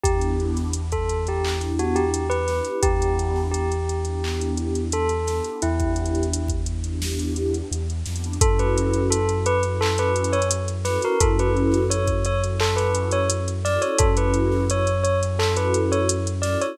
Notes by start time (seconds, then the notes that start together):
0.03 E2 B3 D4 E4 G4, kick, closed hi-hat
0.21 closed hi-hat
0.40 closed hi-hat
0.56 snare, closed hi-hat
0.73 closed hi-hat
0.92 A4, kick, closed hi-hat
1.09 closed hi-hat
1.26 B3 D4 E4 G4, closed hi-hat
1.44 B3 D4 E4 G4, clap
1.61 snare, closed hi-hat
1.79 F#4, closed hi-hat
1.95 G4, closed hi-hat
2.14 closed hi-hat
2.30 B4, closed hi-hat
2.48 B3 D4 E4 G4, snare, closed hi-hat
2.65 closed hi-hat
2.83 E2 B3 D4 E4 G4, kick, closed hi-hat
3.02 closed hi-hat
3.19 closed hi-hat
3.36 snare
3.51 G4, closed hi-hat
3.72 closed hi-hat
3.89 closed hi-hat
4.05 B3 D4 E4 G4, closed hi-hat
4.23 B3 D4 E4 G4, clap
4.41 closed hi-hat
4.57 closed hi-hat
4.75 closed hi-hat
4.92 A4, closed hi-hat
5.09 closed hi-hat
5.27 B3 D4 E4 G4, snare, closed hi-hat
5.44 closed hi-hat
5.62 E2 B3 D4 E4 G4, closed hi-hat
5.80 kick, closed hi-hat
5.96 closed hi-hat
6.06 closed hi-hat
6.15 closed hi-hat
6.23 closed hi-hat
6.33 closed hi-hat
6.48 kick, closed hi-hat
6.66 closed hi-hat
6.84 B3 D4 E4 G4, closed hi-hat
7.02 B3 D4 E4 G4, snare
7.19 closed hi-hat
7.36 closed hi-hat
7.54 closed hi-hat
7.71 E2, closed hi-hat
7.90 closed hi-hat
8.06 F2 B3 D4 E4 G4, snare, closed hi-hat
8.16 closed hi-hat
8.24 closed hi-hat
8.33 closed hi-hat
8.41 F#2 C#4 E4 F#4 A4, kick, closed hi-hat
8.59 B4, closed hi-hat
8.77 closed hi-hat
8.93 closed hi-hat
9.10 A4, closed hi-hat
9.29 closed hi-hat
9.46 B4, closed hi-hat
9.63 C#4 E4 F#4 A4, closed hi-hat
9.81 C#4 E4 F#4 A4, clap
9.98 B4, closed hi-hat
10.16 closed hi-hat
10.24 closed hi-hat
10.33 C#5, closed hi-hat
10.42 closed hi-hat
10.51 closed hi-hat
10.68 closed hi-hat
10.85 C#4 E4 F#4 A4 B4, snare, closed hi-hat
11.02 A#4, closed hi-hat
11.20 F#2 C#4 E4 F#4 A4, kick, closed hi-hat
11.39 B4, closed hi-hat
11.57 closed hi-hat
11.72 snare, closed hi-hat
11.90 C#5, closed hi-hat
12.07 kick, closed hi-hat
12.25 C#5, closed hi-hat
12.42 C#4 E4 F#4 A4, closed hi-hat
12.60 C#4 E4 F#4 A4, clap
12.76 B4, snare, closed hi-hat
12.95 closed hi-hat
13.11 C#5, closed hi-hat
13.30 closed hi-hat
13.48 closed hi-hat
13.65 C#4 E4 F#4 A4 D5, snare, closed hi-hat
13.82 C#5, closed hi-hat
13.98 F#2 C#4 E4 F#4 A4, kick, closed hi-hat
14.17 B4, closed hi-hat
14.34 closed hi-hat
14.51 snare
14.70 C#5, closed hi-hat
14.87 closed hi-hat
15.03 C#5, closed hi-hat
15.22 C#4 E4 F#4 A4, closed hi-hat
15.39 C#4 E4 F#4 A4, clap
15.56 B4, closed hi-hat
15.74 closed hi-hat
15.92 C#5, closed hi-hat
16.09 closed hi-hat
16.27 closed hi-hat
16.42 C#4 E4 F#4 A4 D5, snare, closed hi-hat
16.61 C#5, closed hi-hat